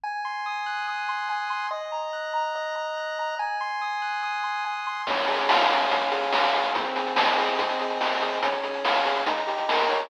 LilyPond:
<<
  \new Staff \with { instrumentName = "Lead 1 (square)" } { \time 4/4 \key des \major \tempo 4 = 143 aes''8 c'''8 ees'''8 ges'''8 ees'''8 c'''8 aes''8 c'''8 | ees''8 bes''8 ges'''8 bes''8 ees''8 bes''8 ges'''8 bes''8 | aes''8 c'''8 ees'''8 ges'''8 ees'''8 c'''8 aes''8 c'''8 | des'8 aes'8 f''8 aes'8 des'8 aes'8 f''8 aes'8 |
c'8 aes'8 ees''8 aes'8 c'8 aes'8 ees''8 aes'8 | des'8 aes'8 f''8 aes'8 ees'8 g'8 bes'8 des''8 | }
  \new DrumStaff \with { instrumentName = "Drums" } \drummode { \time 4/4 r4 r4 r4 r4 | r4 r4 r4 r4 | r4 r4 r4 r4 | <cymc bd>16 hh16 hh16 hh16 sn16 hh16 hh16 hh16 <hh bd>16 hh16 hh16 hh16 sn16 hh16 hh16 hh16 |
<hh bd>16 hh16 hh16 hh16 sn16 hh16 hh16 hh16 <hh bd>16 hh16 hh16 hh16 sn16 hh16 hh16 hh16 | <hh bd>16 hh16 hh16 hh16 sn16 hh16 hh16 hh16 <hh bd>16 hh16 hh16 hh16 sn16 hh16 hh16 hh16 | }
>>